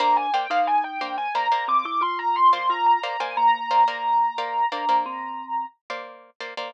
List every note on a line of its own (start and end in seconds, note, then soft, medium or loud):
0.00 0.27 A#3 medium
0.00 0.30 D4 loud
0.00 0.27 C5 loud
0.00 0.27 D5 medium
0.00 0.27 F5 loud
0.00 0.16 A#5 loud
0.17 0.33 G#5 medium
0.34 0.47 A#3 medium
0.34 0.47 C5 medium
0.34 0.47 D5 medium
0.34 0.47 F5 medium
0.34 0.50 G5 medium
0.50 0.91 A#3 medium
0.50 0.99 D#4 loud
0.50 0.91 C5 medium
0.50 0.91 D5 medium
0.50 0.67 F5 medium
0.50 0.91 F5 medium
0.67 0.83 G#5 medium
0.84 1.15 G5 medium
1.01 1.28 A#3 medium
1.01 1.17 D4 medium
1.01 1.28 C5 medium
1.01 1.28 D5 medium
1.01 1.28 F5 medium
1.18 1.34 G#5 medium
1.35 1.48 A#3 medium
1.35 1.48 C5 medium
1.35 1.48 D5 medium
1.35 1.48 F5 medium
1.35 1.65 A#5 medium
1.52 2.06 A#3 medium
1.52 2.06 C5 medium
1.52 2.06 D5 medium
1.52 2.06 F5 medium
1.68 1.84 C4 medium
1.68 1.85 D6 medium
1.85 2.01 E4 medium
1.85 2.02 D6 medium
2.01 2.58 F4 medium
2.01 2.18 C6 medium
2.19 2.35 A#5 medium
2.36 2.52 C6 medium
2.53 2.93 A#3 medium
2.53 2.93 C5 medium
2.53 2.93 D5 medium
2.53 2.93 F5 medium
2.53 2.69 C6 medium
2.70 2.99 F4 medium
2.70 2.86 A#5 loud
2.86 3.02 A#5 medium
3.03 3.17 A#3 medium
3.03 3.17 C5 medium
3.03 3.17 D5 medium
3.03 3.17 F5 medium
3.03 3.20 A#5 medium
3.20 3.61 A#3 medium
3.20 3.61 C5 medium
3.20 3.61 D5 medium
3.20 3.61 F5 medium
3.20 3.36 G#5 medium
3.37 4.61 A#3 loud
3.37 5.66 A#5 loud
3.71 3.84 A#3 medium
3.71 3.84 C5 medium
3.71 3.84 D5 medium
3.71 3.84 F5 medium
3.88 4.28 A#3 medium
3.88 4.28 C5 medium
3.88 4.28 D5 medium
3.88 4.28 F5 medium
4.38 4.65 A#3 medium
4.38 4.65 C5 medium
4.38 4.65 D5 medium
4.38 4.65 F5 medium
4.72 4.85 A#3 medium
4.72 5.05 D4 loud
4.72 4.85 C5 medium
4.72 4.85 D5 medium
4.72 4.85 F5 medium
4.89 5.43 A#3 medium
4.89 5.43 C5 medium
4.89 5.43 D5 medium
4.89 5.43 F5 medium
5.06 5.65 C4 loud
5.90 6.30 A#3 medium
5.90 6.30 C5 medium
5.90 6.30 D5 medium
5.90 6.30 F5 medium
6.40 6.54 A#3 medium
6.40 6.54 C5 medium
6.40 6.54 D5 medium
6.40 6.54 F5 medium
6.57 6.71 A#3 medium
6.57 6.71 C5 medium
6.57 6.71 D5 medium
6.57 6.71 F5 medium